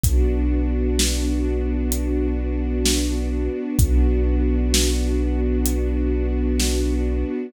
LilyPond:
<<
  \new Staff \with { instrumentName = "String Ensemble 1" } { \time 4/4 \key b \minor \tempo 4 = 64 <b d' fis'>1 | <b d' fis'>1 | }
  \new Staff \with { instrumentName = "Synth Bass 2" } { \clef bass \time 4/4 \key b \minor b,,1 | b,,1 | }
  \new DrumStaff \with { instrumentName = "Drums" } \drummode { \time 4/4 <hh bd>4 sn4 hh4 sn4 | <hh bd>4 sn4 hh4 sn4 | }
>>